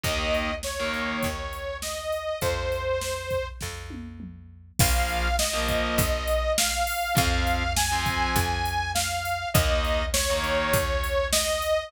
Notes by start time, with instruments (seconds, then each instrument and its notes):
0.03 electric bass (finger) D#2, overdriven guitar D#3 A#3, lead 2 (sawtooth) D#5, kick, closed hi-hat
0.34 closed hi-hat
0.63 lead 2 (sawtooth) C#5, snare
0.80 overdriven guitar D#3 A#3
0.94 closed hi-hat
1.23 electric bass (finger) D#2, kick, closed hi-hat
1.53 closed hi-hat
1.82 lead 2 (sawtooth) D#5, snare
2.12 closed hi-hat
2.41 electric bass (finger) F2, lead 2 (sawtooth) C5, kick, closed hi-hat
2.72 closed hi-hat
3.01 snare
3.30 kick, closed hi-hat
3.61 electric bass (finger) F2, kick, snare
3.90 high tom
4.20 mid tom
4.79 electric bass (finger) A#1, overdriven guitar F3 A#3, lead 2 (sawtooth) F5, kick, crash
5.09 closed hi-hat
5.39 lead 2 (sawtooth) D#5, snare
5.53 overdriven guitar F3 A#3
5.68 kick, closed hi-hat
5.98 electric bass (finger) A#1, kick, closed hi-hat
6.28 closed hi-hat
6.58 lead 2 (sawtooth) F5, snare
6.87 open hi-hat
7.15 electric bass (finger) F2, overdriven guitar F3 C4, lead 2 (sawtooth) F5, kick, closed hi-hat
7.47 closed hi-hat
7.76 lead 2 (sawtooth) G#5, snare
7.92 overdriven guitar F3 C4
8.06 kick, closed hi-hat
8.36 electric bass (finger) F2, kick, closed hi-hat
8.65 closed hi-hat
8.95 lead 2 (sawtooth) F5, snare
9.25 closed hi-hat
9.54 electric bass (finger) D#2, overdriven guitar D#3 A#3, lead 2 (sawtooth) D#5, kick, closed hi-hat
9.85 closed hi-hat
10.13 lead 2 (sawtooth) C#5, snare
10.30 overdriven guitar D#3 A#3
10.44 closed hi-hat
10.73 electric bass (finger) D#2, kick, closed hi-hat
11.04 closed hi-hat
11.33 lead 2 (sawtooth) D#5, snare
11.62 closed hi-hat